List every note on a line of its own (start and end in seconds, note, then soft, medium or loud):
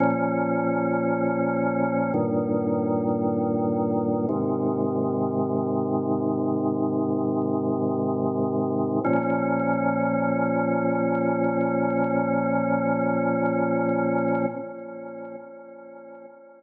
0.00 2.12 A#2 medium
0.00 2.12 F3 medium
0.00 2.12 C#4 medium
2.14 4.26 G2 medium
2.14 4.26 A#2 medium
2.14 4.26 D#3 medium
4.29 9.00 G#2 medium
4.29 9.00 C3 medium
4.29 9.00 D#3 medium
9.04 14.46 A#2 loud
9.04 14.46 F3 loud
9.04 14.46 C#4 loud